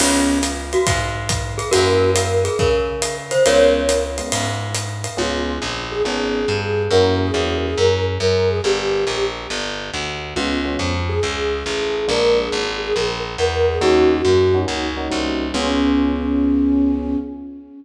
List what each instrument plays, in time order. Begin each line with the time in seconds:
0.00 electric bass (finger) C#2, electric piano 1 B3 C#4 F4 G#4, glockenspiel C#4 F4, crash, ride
0.43 hi-hat pedal, ride
0.73 glockenspiel F#4, ride
0.87 electric bass (finger) G#2, kick, ride
1.29 kick, hi-hat pedal, ride
1.58 glockenspiel G#4, ride
1.71 electric bass (finger) F#2, electric piano 1 A#3 C#4 E4 F#4, glockenspiel F#4 A#4, ride
2.15 glockenspiel A#4, hi-hat pedal, ride
2.45 glockenspiel G#4, ride
2.59 electric bass (finger) C#3, glockenspiel A#4, kick, ride
3.02 hi-hat pedal, ride
3.31 glockenspiel C5, ride
3.46 electric bass (finger) C#2, electric piano 1 G#3 B3 C#4 F4, glockenspiel A#4 C#5, ride
3.89 hi-hat pedal, ride
4.18 electric piano 1 G#3 B3 C#4 F4, ride
4.32 electric bass (finger) G#2, ride
4.75 hi-hat pedal, ride
5.04 ride
5.17 electric bass (finger) C#2, electric piano 1 B3 C#4 F4 G#4, flute F4
5.62 electric bass (finger) A#1
5.91 flute G#4
6.05 electric bass (finger) G#1, electric piano 1 B3 C#4 F4 G#4
6.48 electric bass (finger) G2
6.90 electric bass (finger) F#2, electric piano 1 A#3 C#4 E4 F#4, flute A#4
7.20 flute G#4
7.34 electric bass (finger) E2, electric piano 1 A#3 C#4 E4 F#4
7.63 flute G#4
7.77 electric bass (finger) F#2, flute A#4
8.20 electric bass (finger) F#2, flute A#4
8.48 flute G#4
8.64 electric bass (finger) G1, flute G4
9.07 electric bass (finger) A#1
9.50 electric bass (finger) G1
9.94 electric bass (finger) D2
10.36 electric bass (finger) C#2, electric piano 1 G#3 B3 C#4 F4, flute F4
10.65 electric piano 1 G#3 B3 C#4 F4
10.79 electric bass (finger) F2
11.09 flute G#4
11.23 electric bass (finger) C#2
11.66 electric bass (finger) A1
12.08 electric bass (finger) A#1, electric piano 1 G#3 A#3 D4 F4, flute A#4
12.39 flute G#4
12.52 electric bass (finger) G#1
12.81 flute G#4
12.95 electric bass (finger) A#1, flute A#4
13.38 electric bass (finger) E2, flute A#4
13.67 flute G#4
13.81 electric bass (finger) D#2, electric piano 1 A#3 C#4 D#4 F#4, flute F#4
14.25 electric bass (finger) F#2
14.54 electric piano 1 A#3 C#4 D#4 F#4
14.66 electric bass (finger) C#2, electric piano 1 A#3 C#4 D#4 F#4
14.97 electric piano 1 A#3 C#4 D#4 F#4
15.10 electric bass (finger) C2, electric piano 1 A#3 C#4 D#4 F#4
15.54 electric bass (finger) C#2, electric piano 1 B3 C#4 F4 G#4, flute C#4